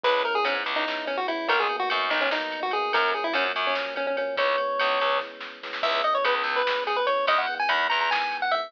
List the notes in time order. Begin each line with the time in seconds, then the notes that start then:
0.03 C#2 G#3 B3 C#4 E4 B4, kick, crash
0.24 G#3 B3 C#4 E4 A#4, ride
0.35 G#4
0.45 G#2 G#3 B3 C#4 E4, ride
0.64 C#2, ride
0.76 D#4
0.86 G#3 B3 C#4 E4, snare
1.07 C#4, ride
1.17 F#4
1.28 G#3 B3 C#4 E4, ride
1.48 B1 F#3 A#3 B3 D#4 A#4, kick, ride
1.60 G#4
1.69 F#3 A#3 B3 D#4, ride
1.79 F#4
1.90 F#2 F#3 A#3 B3 D#4, ride
2.10 B1 D#4, ride
2.21 C#4
2.31 F#3 A#3 B3 D#4, snare
2.52 ride
2.63 F#4
2.71 F#3 A#3 B3 D#4 G#4, ride
2.93 F#2 F3 F#3 A#3 C#4 A#4, kick, ride
3.14 F3 F#3 A#3 C#4 G#4, ride
3.24 E4
3.33 F#2 F3 F#3 A#3 C#4, ride
3.56 F#2, ride
3.67 C#4
3.75 F3 F#3 A#3 C#4, snare
3.96 C#4, ride
4.07 C#4
4.17 F3 F#3 A#3 C#4, ride
4.37 C#2 E3 G#3 B3 C#4 C#5, kick, ride
4.58 E3 G#3 B3 C#4, ride
4.79 C#2 E3 G#3 B3 C#4, ride
4.99 C#2, ride
5.20 E3 G#3 B3 C#4, kick, snare
5.41 snare
5.63 E3 G#3 B3 C#4, snare
5.73 snare
5.83 C#2 E3 G#3 B3 C#4 E5, kick, crash
6.02 E3 G#3 B3 C#4 D#5, ride
6.15 C#5
6.24 C#2 E3 G#3 B3 C#4 B4, ride
6.43 C#2, ride
6.56 B4
6.65 E3 G#3 B3 C#4, snare
6.87 G#4, ride
6.96 B4
7.07 E3 G#3 B3 C#4 C#5, ride
7.27 E2 D#3 E3 G#3 B3 D#5, kick, ride
7.38 F#5
7.47 D#3 E3 G#3 B3, ride
7.59 G#5
7.69 E2 D#3 E3 G#3 B3 B5, ride
7.90 E2 A#5, ride
8.01 A#5
8.10 D#3 E3 G#3 B3 G#5, snare
8.32 ride
8.42 F#5
8.51 D#3 E3 G#3 B3 E5, ride